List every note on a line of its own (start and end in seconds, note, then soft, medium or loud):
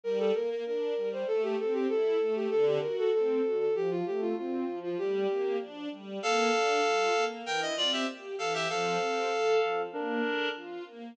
0.03 0.31 G3 medium
0.03 0.18 A#4 loud
0.19 0.33 A4 medium
0.34 0.63 A#3 medium
0.34 0.49 A#4 medium
0.50 0.65 A#4 medium
0.66 0.94 D4 medium
0.66 1.09 A#4 medium
0.96 1.24 G3 medium
1.12 1.27 C5 medium
1.27 1.55 A3 medium
1.27 1.42 A4 loud
1.43 1.57 G4 medium
1.59 1.86 C4 medium
1.59 1.73 A4 medium
1.73 1.88 G4 medium
1.89 2.17 E4 medium
1.89 2.34 A4 medium
2.20 2.48 A3 medium
2.35 2.50 G4 medium
2.50 2.79 D3 loud
2.50 2.65 A4 loud
2.66 2.81 G4 medium
2.81 3.10 F#4 medium
2.81 2.96 A#4 medium
2.98 3.13 A4 medium
3.13 3.41 C4 medium
3.13 3.59 A4 medium
3.44 3.72 F#4 medium
3.59 3.74 A4 medium
3.74 4.02 F3 medium
3.74 3.90 G4 loud
3.90 4.05 F4 loud
4.06 4.34 A3 medium
4.06 4.21 G4 medium
4.21 4.36 F4 loud
4.37 4.65 C4 medium
4.37 4.79 F4 medium
4.67 4.95 F3 medium
4.83 4.98 F4 medium
4.98 5.26 G3 medium
4.98 5.57 G4 loud
5.29 5.57 A#3 medium
5.60 5.88 D4 medium
5.91 6.19 G3 medium
6.22 6.50 A#3 medium
6.22 7.24 A4 loud
6.22 7.24 F5 loud
6.53 6.81 D4 medium
6.84 7.12 F4 medium
7.15 7.43 A#3 medium
7.46 7.74 E3 medium
7.46 7.61 A#4 loud
7.46 7.61 G5 loud
7.61 7.76 D#5 loud
7.77 8.05 C4 medium
7.77 7.92 F4 loud
7.77 7.92 D5 loud
7.92 8.07 G4 medium
7.92 8.07 E5 medium
8.08 8.36 G4 medium
8.38 8.67 E3 medium
8.38 8.53 A4 medium
8.38 8.53 F5 loud
8.54 8.68 G4 loud
8.54 8.68 E5 loud
8.69 8.98 F3 medium
8.69 9.82 A4 medium
8.69 9.82 F5 loud
9.01 9.28 C4 medium
9.32 9.59 A4 medium
9.62 9.90 F3 medium
9.93 10.21 A#3 loud
9.93 10.48 D4 loud
9.93 10.48 A#4 loud
10.24 10.52 D4 medium
10.55 10.83 F4 medium
10.86 11.14 A#3 medium